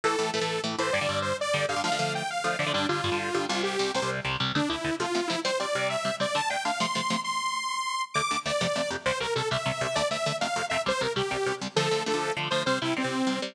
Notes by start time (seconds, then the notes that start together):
0.04 A2 E3 A3 A4
0.19 A2 E3 A3
0.34 A2 E3 A3 A4
0.41 A2 E3 A3
0.64 A2 E3 A3
0.79 A2 E3 A3 C5
0.93 G2 D3 G3 D5
1.01 G2 D3 G3
1.09 G2 D3 G3
1.22 C5
1.41 D5
1.54 G2 D3 G3
1.69 G2 D3 G3 F5
1.76 G2 D3 G3
1.84 D3 F3 A3 F5
1.92 D3 F3 A3
1.99 D3 F3 A3
2.15 G5
2.30 F5
2.44 D3 F3 A3
2.59 D3 F3 A3 D5
2.67 D3 F3 A3
2.73 G2 D3 G3 D4
2.89 G2 D3 G3 F4
3.04 G2 D3 G3
3.12 G2 D3 G3
3.34 G2 D3 G3
3.49 C2 C3 G3 F4
3.63 G4
3.79 C2 C3 G3
3.94 C2 C3 G3 C5
4.02 C2 C3 G3
4.25 C2 C3 G3
4.40 C2 C3 G3
4.55 D2 D3 A3 D4
4.69 D2 D3 A3 E4
4.84 D2 D3 A3
5.00 C3 F3 A3 F4
5.15 C3 F3 A3
5.28 C3 F3 A3 E4
5.45 C3 G3 C4 C5
5.60 C3 G3 C4 D5
5.75 C3 G3 C4
5.90 E5
6.05 C3 G3 C4
6.20 C3 G3 C4 D5
6.35 D3 A3 D4 A5
6.50 D3 A3 D4 G5
6.65 D3 A3 D4 F5
6.80 C3 F3 A3 C6
6.95 C3 F3 A3
7.10 C3 F3 A3
7.24 C6
8.14 D2 D3 A3 D6
8.31 D2 D3 A3
8.46 D2 D3 A3 D5
8.61 F2 C3 A3
8.76 F2 C3 A3
8.90 F2 C3 A3
9.06 C2 C3 G3 C5
9.20 C2 C3 G3 A#4
9.35 C2 C3 G3 A4
9.51 C2 C3 G3 E5
9.66 C2 C3 G3
9.81 C2 C3 G3
9.95 D2 D3 A3 D5
10.11 D2 D3 A3 E5
10.26 D2 D3 A3
10.41 F2 C3 A3 F5
10.56 F2 C3 A3
10.70 F2 C3 A3 E5
10.86 C2 C3 G3 C5
11.01 C2 C3 G3 A#4
11.16 C2 C3 G3 G4
11.31 C2 C3 G3
11.46 C2 C3 G3
11.61 C2 C3 G3
11.76 D3 F3 A3 A4
11.91 D3 F3 A3
12.06 D3 F3 A3 A4
12.14 D3 F3 A3
12.37 D3 F3 A3
12.51 D3 F3 A3 C5
12.66 C3 G3 C4 C5
12.82 C3 G3 C4 E4
12.97 C3 G3 C4
13.04 C3 G3 C4
13.27 C3 G3 C4
13.42 C3 G3 C4